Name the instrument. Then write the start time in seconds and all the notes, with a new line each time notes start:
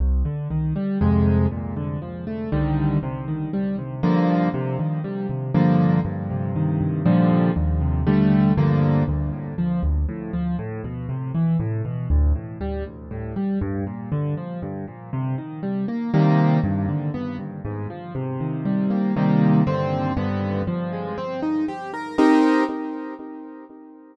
acoustic grand piano
0.00 C2
0.25 D3
0.51 D#3
0.76 G3
1.01 F2 C3 G#3
1.51 A#2
1.76 D3
2.02 F3
2.27 A3
2.52 C2 D3 D#3 G3
3.03 C3
3.28 D#3
3.53 G3
3.78 C3
4.03 G2 D3 F3 A#3
4.54 C3
4.79 D#3
5.04 G3
5.29 C3
5.54 G2 D3 F3 A#3
6.05 G2
6.30 C3
6.55 D#3
6.81 G2
7.06 A#2 D3 F3 G3
7.56 D#2
7.81 C3
8.07 D3 G3 A3
8.57 G2 D3 F3 A#3
9.08 D2
9.33 A2
9.58 F3
9.83 D2
10.09 A2
10.33 F3
10.59 A2
10.84 B2
11.09 C3
11.35 E3
11.60 A2
11.85 B2
12.10 D2
12.35 A2
12.61 G3
12.86 D2
13.11 A2
13.36 G3
13.61 G2
13.87 A#2
14.12 D3
14.37 F3
14.62 G2
14.88 A#2
15.13 C3
15.38 D#3
15.63 G3
15.88 A#3
16.14 C3 D#3 G3 A#3
16.64 G2
16.89 D3
17.14 B3
17.39 G2
17.65 G#2
17.90 F3
18.15 C3
18.40 D#3
18.65 G3
18.90 A#3
19.16 C3 D#3 G3 A#3
19.67 G2 D3 C4
20.17 G2 D3 B3
20.67 F3
20.93 G#3
21.18 C4
21.42 D#4
21.68 G4
21.94 A#4
22.18 C4 D#4 G4 A#4